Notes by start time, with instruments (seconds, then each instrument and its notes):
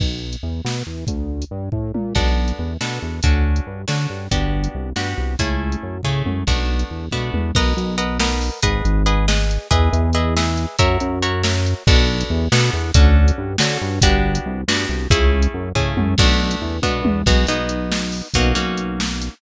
0.00 synth bass 1 B1, kick, crash
0.33 closed hi-hat
0.43 synth bass 1 E2
0.65 synth bass 1 B2, snare
0.87 synth bass 1 E2
1.07 synth bass 1 D2, kick, closed hi-hat
1.42 closed hi-hat
1.51 synth bass 1 G2
1.72 synth bass 1 A2, kick
1.94 synth bass 1 A#2, high tom
2.15 synth bass 1 B1, acoustic guitar (steel) B3 D4 F#4 A4, kick, crash
2.48 closed hi-hat
2.59 synth bass 1 E2
2.81 synth bass 1 B2, acoustic guitar (steel) B3 D4 F#4 A4, snare
3.02 synth bass 1 E2
3.23 synth bass 1 D2, acoustic guitar (steel) C#4 D4 F#4 A4, kick, closed hi-hat
3.56 closed hi-hat
3.67 synth bass 1 G2
3.88 synth bass 1 D3, acoustic guitar (steel) C#4 D4 F#4 A4, snare
4.10 synth bass 1 G2
4.31 synth bass 1 G1, acoustic guitar (steel) B3 D4 F#4 G4, kick, closed hi-hat
4.64 closed hi-hat
4.75 synth bass 1 C2
4.96 synth bass 1 G2, acoustic guitar (steel) B3 D4 F#4 G4, snare
5.18 synth bass 1 C2
5.39 synth bass 1 C#2, acoustic guitar (steel) A3 C#4 E4 G#4, kick, closed hi-hat
5.72 closed hi-hat
5.83 synth bass 1 F#2
6.03 synth bass 1 C#3, acoustic guitar (steel) A3 C#4 E4 G#4, kick, floor tom
6.26 synth bass 1 F#2, high tom
6.47 synth bass 1 B1, acoustic guitar (steel) A3 B3 D4 F#4, kick, crash
6.79 closed hi-hat
6.91 synth bass 1 E2
7.11 synth bass 1 B2, acoustic guitar (steel) A3 B3 D4 F#4, kick, high tom
7.34 synth bass 1 E2, high tom
7.55 synth bass 1 B1, acoustic guitar (steel) A#4 B4 D#5 F#5, kick, crash
7.77 synth bass 1 B1, closed hi-hat
7.98 acoustic guitar (steel) A#4 B4 D#5 F#5, closed hi-hat
8.20 acoustic guitar (steel) A#4 B4 D#5 F#5, snare
8.41 open hi-hat
8.63 synth bass 1 G#1, acoustic guitar (steel) G#4 B4 D#5 F#5, kick, closed hi-hat
8.85 synth bass 1 G#1, closed hi-hat
9.06 acoustic guitar (steel) G#4 B4 D#5 F#5, closed hi-hat
9.28 acoustic guitar (steel) G#4 B4 D#5 F#5, snare
9.51 closed hi-hat
9.71 synth bass 1 E2, acoustic guitar (steel) G#4 B4 D#5 E5, kick, closed hi-hat
9.93 synth bass 1 E2, closed hi-hat
10.13 acoustic guitar (steel) G#4 B4 D#5 E5, closed hi-hat
10.37 acoustic guitar (steel) G#4 B4 D#5 E5, snare
10.57 closed hi-hat
10.79 synth bass 1 F#2, acoustic guitar (steel) F#4 A#4 C#5 E5, kick, closed hi-hat
11.00 synth bass 1 F#2, closed hi-hat
11.22 acoustic guitar (steel) F#4 A#4 C#5 E5, closed hi-hat
11.43 acoustic guitar (steel) F#4 A#4 C#5 E5, snare
11.66 closed hi-hat
11.87 synth bass 1 B1, acoustic guitar (steel) B3 D4 F#4 A4, kick, crash
12.21 closed hi-hat
12.30 synth bass 1 E2
12.52 synth bass 1 B2, acoustic guitar (steel) B3 D4 F#4 A4, snare
12.73 synth bass 1 E2
12.94 synth bass 1 D2, acoustic guitar (steel) C#4 D4 F#4 A4, kick, closed hi-hat
13.28 closed hi-hat
13.38 synth bass 1 G2
13.58 synth bass 1 D3, acoustic guitar (steel) C#4 D4 F#4 A4, snare
13.81 synth bass 1 G2
14.02 synth bass 1 G1, acoustic guitar (steel) B3 D4 F#4 G4, kick, closed hi-hat
14.35 closed hi-hat
14.46 synth bass 1 C2
14.68 synth bass 1 G2, acoustic guitar (steel) B3 D4 F#4 G4, snare
14.89 synth bass 1 C2
15.10 synth bass 1 C#2, acoustic guitar (steel) A3 C#4 E4 G#4, kick, closed hi-hat
15.42 closed hi-hat
15.54 synth bass 1 F#2
15.75 synth bass 1 C#3, acoustic guitar (steel) A3 C#4 E4 G#4, kick, floor tom
15.97 synth bass 1 F#2, high tom
16.18 synth bass 1 B1, acoustic guitar (steel) A3 B3 D4 F#4, kick, crash
16.51 closed hi-hat
16.62 synth bass 1 E2
16.82 synth bass 1 B2, acoustic guitar (steel) A3 B3 D4 F#4, kick, high tom
17.05 synth bass 1 E2, high tom
17.26 synth bass 1 B1, acoustic guitar (steel) B3 D#4 F#4 G#4, kick, crash
17.47 synth bass 1 B1, acoustic guitar (steel) B3 D#4 F#4 G#4, closed hi-hat
17.69 closed hi-hat
17.92 snare
18.12 open hi-hat
18.34 synth bass 1 B1, acoustic guitar (steel) A#3 C#4 D#4 F#4, kick, closed hi-hat
18.55 synth bass 1 B1, acoustic guitar (steel) A#3 C#4 D#4 F#4, closed hi-hat
18.78 closed hi-hat
19.00 snare
19.22 closed hi-hat